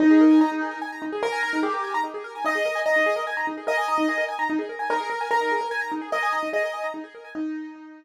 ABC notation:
X:1
M:6/8
L:1/16
Q:3/8=98
K:Eb
V:1 name="Acoustic Grand Piano"
E4 E4 z4 | B4 G4 z4 | e4 e4 z4 | e6 z6 |
B4 B4 z4 | e4 e4 z4 | E8 z4 |]
V:2 name="Acoustic Grand Piano"
z A B a b E A B a b E A | z a b E A B a b E A B a | E A B a b E A B a b E A | B a b E A B a b E A B a |
E A B a b E A B a b E A | B a b E A B a b E A B a | z12 |]